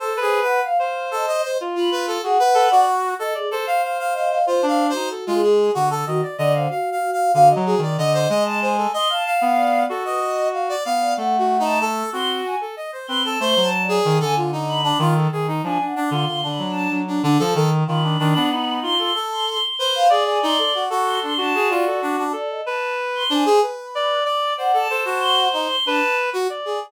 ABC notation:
X:1
M:7/8
L:1/16
Q:1/4=94
K:none
V:1 name="Brass Section"
(3A2 ^G2 B2 f f2 A ^d c z F B A | ^G B2 ^F3 A z A =f f f f f | (3c2 f2 c2 A F ^G2 ^F A ^d =d ^d =f | (3f2 f2 f2 f ^d ^G =d ^d c d d c A |
^d f f4 A d3 f =d f2 | (3A2 ^F2 ^D2 A2 F3 A ^d c B A | c2 z ^G2 A F ^D2 =D F A G ^D | D D D F2 D4 D D A A z |
F D D D ^D3 A A3 z c2 | ^G2 ^D A ^F F2 =D D G =F A D D | z6 D ^G B4 d2 | c A A ^F3 ^D z =D z2 F z ^G |]
V:2 name="Clarinet"
c B3 z c5 F4 | ^F z A d z3 d c6 | F D2 ^D z ^G,3 =D,2 ^D, z =D,2 | z4 (3D,2 ^F,2 ^D,2 =D,2 ^G,4 |
z3 B,3 ^F6 B,2 | A,6 C2 z4 C2 | A, ^F,3 ^D, =D,5 ^D,2 D,2 | F, z2 D, D, D, ^F,2 F,2 D, =F, ^D,2 |
^D,2 D, B,3 F2 z4 B2 | d d4 A3 ^F6 | A2 B4 c2 z2 d2 d2 | d2 c6 B3 z d2 |]
V:3 name="Choir Aahs"
(3A2 c2 ^f2 =f z2 ^d d2 z b z2 | ^f4 z2 ^d ^G z4 d2 | (3c4 ^F4 ^G4 z2 F z d c | ^F2 F2 F2 F d ^d3 a ^g2 |
(3c'2 a2 ^f2 d2 z B z5 d | ^f3 a z2 c' z ^g z3 c' a | (3c'2 a2 d2 z ^g z2 b2 z4 | (3^g2 ^f2 c'2 (3c'2 b2 a2 z6 |
b6 c' c' z c' c' c' c' f | z ^g c'2 z2 c' c' a2 d2 ^F2 | d ^d a2 z c' ^g2 z6 | (3^f2 a2 a2 (3c'2 c'2 c'2 a2 z4 |]